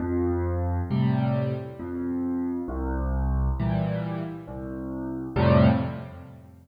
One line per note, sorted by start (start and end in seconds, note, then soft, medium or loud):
0.00 0.80 F2 medium
0.90 1.53 A2 medium
0.90 1.53 C3 medium
0.90 1.53 G3 medium
1.79 2.60 F2 medium
2.68 3.49 C2 loud
3.60 4.22 A#2 medium
3.60 4.22 E3 medium
3.60 4.22 G3 medium
4.48 5.28 C2 medium
5.36 5.67 F2 loud
5.36 5.67 A2 loud
5.36 5.67 C3 medium
5.36 5.67 G3 loud